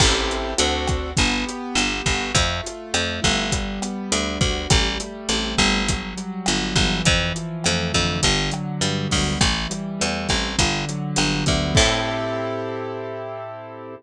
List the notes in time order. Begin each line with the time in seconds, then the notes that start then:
0.00 A1 C4 E4 G4 A4, kick, cross-stick, crash
0.31 closed hi-hat
0.58 D2 C4 D4 F#4 A4, closed hi-hat
0.87 kick, cross-stick, closed hi-hat
1.17 G1 B3, kick, closed hi-hat
1.46 G4, closed hi-hat
1.75 G1 B3, cross-stick, closed hi-hat
2.06 G1 F#4, kick, closed hi-hat
2.35 F2 A3, kick, closed hi-hat
2.63 F4, closed hi-hat
2.94 F2 A3, cross-stick, closed hi-hat
3.22 G1 E4, kick, closed hi-hat
3.52 G3, kick, closed hi-hat
3.81 B3, cross-stick, closed hi-hat
4.12 D2 D4, closed hi-hat
4.41 D2 F#4, kick, closed hi-hat
4.70 A1 G3, kick, cross-stick, closed hi-hat
5.00 A3, closed hi-hat
5.29 A1 C4, closed hi-hat
5.58 G1 E4, kick, cross-stick, closed hi-hat
5.88 F#3, kick, closed hi-hat
6.17 G3, closed hi-hat
6.46 G1 B3, cross-stick, closed hi-hat
6.75 G1 E3, kick, closed hi-hat
7.05 F2, kick, closed hi-hat
7.35 F3, closed hi-hat
7.64 F2 A3, cross-stick, closed hi-hat
7.94 F2 D3, kick, closed hi-hat
8.23 G1, kick, closed hi-hat
8.51 F#3, cross-stick, closed hi-hat
8.81 G2 G3, closed hi-hat
9.10 D2 B3, kick, open hi-hat
9.41 A1 E3, kick, cross-stick, closed hi-hat
9.70 G3, closed hi-hat
10.00 E2 A3, closed hi-hat
10.29 A1 C4, kick, cross-stick, closed hi-hat
10.59 G1 D3, kick, closed hi-hat
10.89 F#3, closed hi-hat
11.16 G1 G3, cross-stick, closed hi-hat
11.46 D2 B3, kick, closed hi-hat
11.75 A2 C4 E4 G4 A4, kick, crash